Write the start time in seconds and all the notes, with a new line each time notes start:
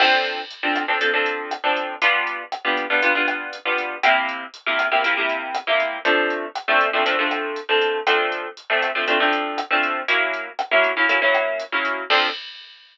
0.00 F3 C4 D4 A4, kick, cross-stick, crash
0.25 closed hi-hat
0.50 closed hi-hat
0.63 F3 C4 D4 A4
0.76 kick, cross-stick, closed hi-hat
0.88 F3 C4 D4 A4
1.01 F3 C4 D4 A4, kick, closed hi-hat
1.14 F3 C4 D4 A4
1.26 closed hi-hat
1.51 cross-stick, closed hi-hat
1.64 F3 C4 D4 A4
1.76 kick, closed hi-hat
2.02 G3 B3 D4 F4, kick, closed hi-hat
2.27 closed hi-hat
2.52 cross-stick, closed hi-hat
2.65 G3 B3 D4 F4
2.77 kick, closed hi-hat
2.90 G3 B3 D4 F4
3.02 G3 B3 D4 F4, kick, closed hi-hat
3.15 G3 B3 D4 F4
3.28 cross-stick, closed hi-hat
3.53 closed hi-hat
3.65 G3 B3 D4 F4
3.78 kick, closed hi-hat
4.03 C3 A#3 E4 G4, kick, cross-stick, closed hi-hat
4.29 closed hi-hat
4.54 closed hi-hat
4.66 C3 A#3 E4 G4
4.79 kick, cross-stick, closed hi-hat
4.91 C3 A#3 E4 G4
5.04 C3 A#3 E4 G4, kick, closed hi-hat
5.17 C3 A#3 E4 G4
5.29 closed hi-hat
5.55 cross-stick, closed hi-hat
5.67 C3 A#3 E4 G4
5.80 kick, closed hi-hat
6.05 F3 A3 C4 D4, kick, closed hi-hat
6.30 closed hi-hat
6.55 cross-stick, closed hi-hat
6.68 F3 A3 C4 D4
6.81 kick, closed hi-hat
6.93 F3 A3 C4 D4
7.06 F3 A3 C4 D4, kick, closed hi-hat
7.19 F3 A3 C4 D4
7.31 cross-stick, closed hi-hat
7.56 closed hi-hat
7.69 F3 A3 C4 D4
7.82 kick, closed hi-hat
8.07 F3 A3 C4 D4, kick, cross-stick, closed hi-hat
8.32 closed hi-hat
8.57 closed hi-hat
8.70 F3 A3 C4 D4
8.82 kick, cross-stick, closed hi-hat
8.95 F3 A3 C4 D4
9.07 F3 A3 C4 D4, kick, closed hi-hat
9.20 F3 A3 C4 D4
9.33 closed hi-hat
9.58 cross-stick, closed hi-hat
9.71 F3 A3 C4 D4
9.83 kick, closed hi-hat
10.08 F#3 A#3 C#4 E4, kick, closed hi-hat
10.34 closed hi-hat
10.59 cross-stick, closed hi-hat
10.71 F#3 A#3 C#4 E4
10.84 kick, closed hi-hat
10.97 F#3 A#3 C#4 E4
11.09 F#3 A#3 C#4 E4, kick, closed hi-hat
11.22 F#3 A#3 C#4 E4
11.34 cross-stick, closed hi-hat
11.60 closed hi-hat
11.72 F#3 A#3 C#4 E4
11.85 kick, closed hi-hat
12.10 F3 C4 D4 A4, kick, crash